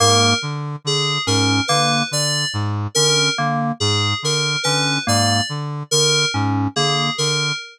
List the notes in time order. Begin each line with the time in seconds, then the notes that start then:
0.00 G#2 A#3 A#4
0.42 D3
0.85 D3 G#4
1.27 G#2 C#4 A#4
1.68 D3 A#3 B4
2.11 D3 D5
2.54 G#2
2.95 D3 C#4 A#4
3.38 D3 A#3
3.80 G#2 G#4
4.23 D3 A#4
4.63 D3 C#4 B4
5.07 G#2 A#3 D5
5.49 D3
5.91 D3 A#4
6.34 G#2 C#4
6.76 D3 A#3 G#4
7.18 D3 A#4